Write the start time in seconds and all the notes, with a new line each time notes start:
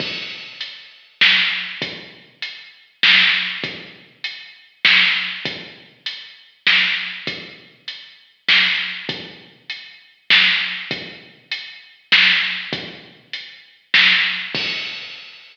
0.00 kick, crash
0.61 closed hi-hat
1.21 snare
1.82 kick, closed hi-hat
2.42 closed hi-hat
3.03 snare
3.64 kick, closed hi-hat
4.24 closed hi-hat
4.85 snare
5.45 kick, closed hi-hat
6.06 closed hi-hat
6.67 snare
7.27 kick, closed hi-hat
7.88 closed hi-hat
8.48 snare
9.09 kick, closed hi-hat
9.70 closed hi-hat
10.30 snare
10.91 kick, closed hi-hat
11.52 closed hi-hat
12.12 snare
12.73 kick, closed hi-hat
13.33 closed hi-hat
13.94 snare
14.55 kick, crash